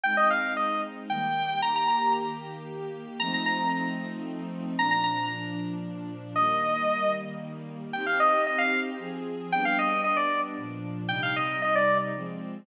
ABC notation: X:1
M:3/4
L:1/16
Q:1/4=114
K:Eb
V:1 name="Lead 1 (square)"
g e f2 e2 z2 g4 | b b b2 z8 | b b b2 z8 | b b b2 z8 |
e6 z6 | [K:Cm] g f e2 e f2 z5 | g f e2 e d2 z5 | g f e2 e d2 z5 |]
V:2 name="Pad 2 (warm)"
[A,CE]8 [E,G,B,]4 | [E,B,G]12 | [F,=A,CE]12 | [B,,F,D]12 |
[E,G,B,]12 | [K:Cm] [CEG]8 [F,CA]4 | [G,=B,D]8 [_B,,F,D]4 | [C,G,E]8 [F,A,C]4 |]